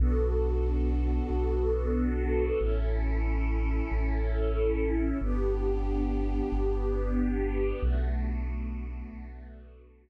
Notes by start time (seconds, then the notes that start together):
0.00 B1 B3 D4 F#4 A4
1.30 B1
2.60 A1 C#4 E4 A4
3.91 A1
5.21 G1 B3 D4 G4
6.52 G1
7.82 B1 A3 B3 D4 F#4
9.13 B1